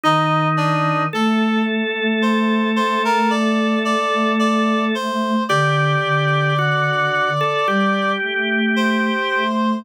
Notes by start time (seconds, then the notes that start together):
0.04 D#3 D#4 D#5
0.57 D4 D5
1.13 A3 A4 A5
2.22 C5 C6
2.76 C5 C6
3.05 A#4 A#5
3.30 D5 D6
3.85 D5 D6
4.39 D5 D6
4.95 C5 C6
5.49 D3 G4 D5 D6
6.03 D3
6.59 F#4
7.41 A4
7.67 G3 G4
8.22 A3
8.76 C5 C6
9.31 A3